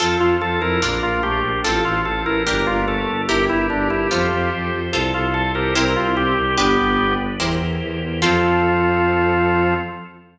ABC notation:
X:1
M:2/2
L:1/8
Q:1/2=73
K:F
V:1 name="Drawbar Organ"
A F A B B F G2 | A F A B B F A2 | G E D E F2 z2 | A F A B B F G2 |
G3 z5 | F8 |]
V:2 name="Drawbar Organ"
F2 F E B,2 A, z | F2 F E B,2 A, z | G8 | A2 A G C2 C z |
=B,3 z5 | F,8 |]
V:3 name="Orchestral Harp"
[CFA]4 [DFB]4 | [CFA]4 [DGB]4 | [EGB]4 [FAc]4 | [FAc]4 [EGBc]4 |
[DG=B]4 [EG_Bc]4 | [CFA]8 |]
V:4 name="Violin" clef=bass
F,, F,, F,, F,, B,,, B,,, B,,, B,,, | A,,, A,,, A,,, A,,, G,,, G,,, G,,, G,,, | G,,, G,,, G,,, G,,, F,, F,, F,, F,, | C,, C,, C,, C,, C,, C,, C,, C,, |
G,,, G,,, G,,, G,,, E,, E,, E,, E,, | F,,8 |]
V:5 name="Drawbar Organ"
[CFA]4 [DFB]4 | [CFA]4 [DGB]4 | [EGB]4 [FAc]4 | [FAc]4 [EGBc]4 |
[DG=B]4 [EG_Bc]4 | [CFA]8 |]